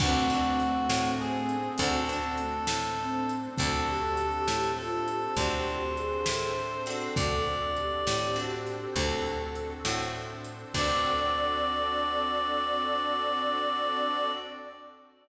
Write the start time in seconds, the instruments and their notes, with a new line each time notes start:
0.00 electric bass (finger) D2, ocarina A3 C4, acoustic guitar (steel) C4 D4 F#4 A4, pad 5 (bowed) C4 D4 F#4 A4, clarinet F#4, kick, crash
0.30 acoustic guitar (steel) C4 D4 F#4 A4
0.60 closed hi-hat
0.89 electric bass (finger) A2, pad 5 (bowed) C4 D4 A4 C5, snare
1.20 clarinet G#4
1.49 closed hi-hat
1.78 electric bass (finger) D2, acoustic guitar (steel) C4 D4 F#4 A4, pad 5 (bowed) C4 D4 F#4 A4, ocarina C4, clarinet A4, kick, closed hi-hat
2.09 acoustic guitar (steel) C4 D4 F#4 A4
2.37 ocarina A3, closed hi-hat
2.67 electric bass (finger) A2, pad 5 (bowed) C4 D4 A4 C5, snare
2.99 ocarina C4
3.29 closed hi-hat
3.57 electric bass (finger) D2, pad 5 (bowed) C4 D4 F#4 A4, acoustic guitar (steel) C4 D4 F#4 A4, clarinet A4, ocarina A4, kick, closed hi-hat
3.86 ocarina G4
4.17 closed hi-hat
4.48 electric bass (finger) A2, pad 5 (bowed) C4 D4 A4 C5, snare
4.77 ocarina F4, clarinet A4
5.07 ocarina G4, closed hi-hat
5.36 electric bass (finger) D2, pad 5 (bowed) C4 D4 F#4 A4, acoustic guitar (steel) C4 D4 F#4 A4, clarinet C5, kick, closed hi-hat
5.96 ocarina G#4, closed hi-hat
6.26 electric bass (finger) A2, pad 5 (bowed) C4 D4 A4 C5, ocarina A4, snare
6.86 acoustic guitar (steel) C4 D4 F#4 A4, ocarina A4, closed hi-hat
7.15 electric bass (finger) D2, pad 5 (bowed) C4 D4 F#4 A4, ocarina A4, clarinet D5, kick, closed hi-hat
7.76 ocarina G4, closed hi-hat
8.06 electric bass (finger) A2, pad 5 (bowed) C4 D4 A4 C5, snare
8.36 acoustic guitar (steel) C4 D4 F#4 A4
8.67 closed hi-hat
8.95 electric bass (finger) D2, pad 5 (bowed) C4 D4 F#4 A4, acoustic guitar (steel) C4 D4 F#4 A4, ocarina A4, kick, closed hi-hat
9.55 closed hi-hat
9.84 electric bass (finger) A2, pad 5 (bowed) C4 D4 A4 C5, acoustic guitar (steel) C4 D4 F#4 A4, snare
10.45 closed hi-hat
10.73 electric bass (finger) D2, acoustic guitar (steel) C4 D4 F#4 A4, pad 5 (bowed) C4 D4 F#4 A4, ocarina D5, clarinet D5, kick, crash